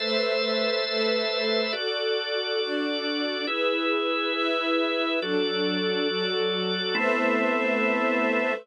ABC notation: X:1
M:6/8
L:1/8
Q:3/8=69
K:Ador
V:1 name="Drawbar Organ"
[ABce]6 | [FAd]6 | [E^GB]6 | [FAd]6 |
[A,B,CE]6 |]
V:2 name="String Ensemble 1"
[A,Bce]3 [A,ABe]3 | [FAd]3 [DFd]3 | [E^GB]3 [EBe]3 | [F,DA]3 [F,FA]3 |
[A,Bce]6 |]